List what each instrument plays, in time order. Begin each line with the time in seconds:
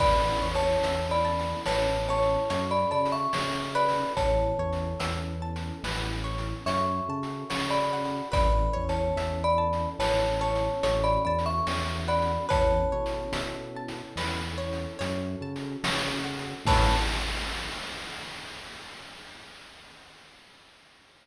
0.00 synth bass 1 A1, pad 2 (warm) B3 C#4 E4 A4, pizzicato strings B4, marimba D5 B5, kick, crash
0.42 synth bass 1 E2, pizzicato strings C#5
0.55 marimba C#5 A5, closed hi-hat
0.83 synth bass 1 E2, pizzicato strings E5, closed hi-hat
1.11 marimba D5 B5
1.25 pizzicato strings A5
1.39 closed hi-hat
1.66 synth bass 1 A1, pizzicato strings B4, marimba C#5 A5, snare
2.09 marimba C#5 A5, pizzicato strings C#5
2.23 closed hi-hat
2.49 synth bass 1 F#2, pad 2 (warm) C#4 F#4 A4, pizzicato strings C#5, closed hi-hat
2.71 marimba D5 B5
2.91 synth bass 1 C#3, marimba D5 B5, pizzicato strings A5
3.06 closed hi-hat
3.12 marimba E5 C#6
3.33 synth bass 1 C#3, pizzicato strings C#5, snare
3.75 pizzicato strings B4, marimba D5 B5
3.89 open hi-hat
4.15 synth bass 1 A1, pad 2 (warm) B3 C#4 E4 A4, marimba C#5 A5, kick, closed hi-hat
4.59 synth bass 1 E2, pizzicato strings C#5
4.73 closed hi-hat
5.00 synth bass 1 E2, pizzicato strings E5, closed hi-hat
5.42 pizzicato strings A5
5.56 closed hi-hat
5.83 synth bass 1 A1, pizzicato strings B4, snare
6.24 pizzicato strings C#5
6.38 closed hi-hat
6.65 synth bass 1 F#2, pad 2 (warm) C#4 F#4 A4, pizzicato strings C#5, marimba E5 C#6, closed hi-hat
7.09 synth bass 1 C#3, pizzicato strings A5
7.23 closed hi-hat
7.50 synth bass 1 C#3, pizzicato strings C#5, snare
7.70 marimba D5 B5
7.93 pizzicato strings F#5
8.05 closed hi-hat
8.32 synth bass 1 A1, pad 2 (warm) B3 C#4 E4 A4, pizzicato strings B4, marimba D5 B5, kick, closed hi-hat
8.73 synth bass 1 E2, pizzicato strings C#5
8.89 marimba C#5 A5, closed hi-hat
9.16 synth bass 1 E2, pizzicato strings E5, closed hi-hat
9.44 marimba D5 B5
9.58 pizzicato strings A5
9.73 closed hi-hat
9.99 synth bass 1 A1, pizzicato strings B4, marimba C#5 A5, snare
10.41 pizzicato strings C#5, marimba C#5 A5
10.55 closed hi-hat
10.83 synth bass 1 A1, pad 2 (warm) C#4 F#4 A4, pizzicato strings C#5, closed hi-hat
11.04 marimba D5 B5
11.25 synth bass 1 E2, marimba D5 B5, pizzicato strings A5
11.39 closed hi-hat
11.46 marimba E5 C#6
11.67 synth bass 1 E2, pizzicato strings C#5, snare
12.08 marimba D5 B5, pizzicato strings F#5
12.22 closed hi-hat
12.49 synth bass 1 E2, pad 2 (warm) B3 C#4 E4 A4, pizzicato strings B4, marimba C#5 A5, kick, closed hi-hat
12.92 synth bass 1 B2, pizzicato strings C#5
13.06 closed hi-hat
13.32 synth bass 1 B2, pizzicato strings E5, closed hi-hat
13.76 pizzicato strings A5
13.88 closed hi-hat
14.16 synth bass 1 E2, pizzicato strings B4, snare
14.58 pizzicato strings C#5
14.73 closed hi-hat
14.99 synth bass 1 F#2, pad 2 (warm) C#4 F#4 A4, pizzicato strings C#5, closed hi-hat
15.41 synth bass 1 C#3, pizzicato strings A5
15.56 closed hi-hat
15.83 synth bass 1 C#3, pizzicato strings C#5, snare
16.24 pizzicato strings F#5
16.39 closed hi-hat
16.65 synth bass 1 A2, pad 2 (warm) B3 C#4 E4 A4, pizzicato strings B4 C#5 E5 A5, marimba A5, kick, crash